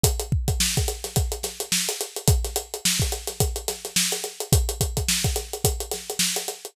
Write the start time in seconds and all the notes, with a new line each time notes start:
0.04 kick, closed hi-hat
0.20 closed hi-hat
0.32 kick
0.48 kick, closed hi-hat
0.60 snare
0.77 kick, closed hi-hat
0.88 closed hi-hat
1.04 snare, closed hi-hat
1.16 kick, closed hi-hat
1.32 closed hi-hat
1.43 snare, closed hi-hat
1.60 closed hi-hat
1.72 snare
1.88 snare, closed hi-hat
2.01 closed hi-hat
2.16 closed hi-hat
2.28 kick, closed hi-hat
2.45 snare, closed hi-hat
2.56 closed hi-hat
2.74 closed hi-hat
2.85 snare
3.00 kick, closed hi-hat
3.12 closed hi-hat
3.27 snare, closed hi-hat
3.40 kick, closed hi-hat
3.56 closed hi-hat
3.68 snare, closed hi-hat
3.85 snare, closed hi-hat
3.96 snare
4.12 snare, closed hi-hat
4.24 closed hi-hat
4.40 closed hi-hat
4.52 kick, closed hi-hat
4.69 closed hi-hat
4.81 kick, closed hi-hat
4.97 kick, closed hi-hat
5.09 snare
5.24 kick, closed hi-hat
5.36 snare, closed hi-hat
5.53 closed hi-hat
5.64 kick, closed hi-hat
5.80 closed hi-hat
5.91 snare, closed hi-hat
6.10 closed hi-hat
6.19 snare
6.36 closed hi-hat
6.48 closed hi-hat
6.65 closed hi-hat